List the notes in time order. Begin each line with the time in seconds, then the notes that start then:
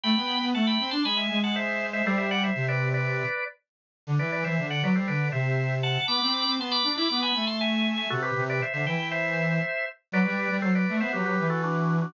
0.03 A3 G5 B5
0.16 B3
0.42 B3
0.54 A3 F#5 A5
0.67 G5 B5
0.80 C4
0.91 D4 A5 C6
1.04 G#3 G#5 B5
1.17 E5 G#5
1.30 G#3
1.43 F#5 A5
1.56 C5 E5
1.93 C5 E5
2.05 G3 A4 C5
2.18 C5 E5
2.31 D5 F#5
2.44 C5 E5
2.55 C3
2.68 B4 D5
2.94 B4 D5
4.07 D3
4.19 E3 B4 D5
4.32 B4 D5
4.44 E3 C5 E5
4.58 D3
4.70 D5 F#5
4.82 F#3 B4 D5
4.95 G3 A4 C5
5.08 D3 B4 D5
5.32 C3 C5 E5
5.83 F#5 A5
6.08 B3 B5 D6
6.22 C4
6.45 C4
6.58 B3 A5 C6
6.71 B5 D6
6.84 D4
6.96 E4 B5 D6
7.09 B3 B5 D6
7.22 G#5 B5
7.35 A3
7.47 A5 C6
7.61 E5 G#5
7.97 E5 G#5
8.10 C3 F#4 A4
8.22 G4 B4
8.36 C3
8.49 B4 D5
8.62 C5 E5
8.73 D3 C5 E5
8.86 E3 E5 G5
9.11 C5 E5
10.12 F#3 B4 D5
10.25 G3
10.50 G3
10.62 F#3 A4 C5
10.75 B4 D5
10.89 A3
11.00 B3 C5 E5
11.13 F#3 G4 B4
11.26 G4 B4
11.39 E3
11.50 F#4 A4
11.63 D4 F#4
12.02 D4 F#4